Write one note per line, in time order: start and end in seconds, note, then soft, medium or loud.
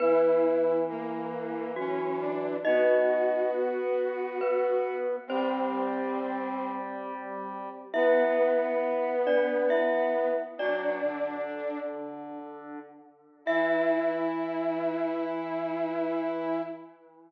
0.00 2.57 E3 loud
0.00 0.85 B3 medium
0.00 0.76 E4 medium
0.00 0.85 B4 loud
0.89 1.71 A#3 medium
1.76 2.53 F#3 medium
1.76 2.22 C#4 medium
1.76 2.53 F#4 medium
2.20 2.56 D4 medium
2.65 5.16 B3 loud
2.65 3.50 D#4 medium
2.65 4.96 F#4 medium
2.65 3.50 D#5 medium
4.41 5.19 B3 medium
4.41 5.19 B4 medium
5.27 7.69 G3 loud
5.27 6.69 C4 medium
5.27 7.85 C4 medium
5.27 7.85 C5 medium
7.94 10.34 B3 loud
7.94 10.31 B3 medium
7.94 9.15 E4 medium
7.94 9.15 E5 medium
9.27 9.70 D4 medium
9.27 9.70 D5 medium
9.70 10.42 E4 medium
9.70 10.42 E5 medium
10.58 10.99 F#3 loud
10.58 11.79 D4 medium
10.58 12.39 D4 medium
10.58 12.39 D5 medium
11.03 12.79 D3 medium
13.45 16.62 E3 loud
13.45 16.60 E4 loud
13.45 16.62 E5 loud